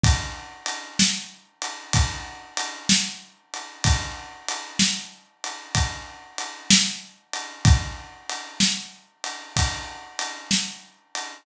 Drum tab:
RD |x-x--xx-x--x|x-x--xx-x--x|x-x--xx-x--x|
SD |---o-----o--|---o-----o--|---o-----o--|
BD |o-----o-----|o-----o-----|o-----o-----|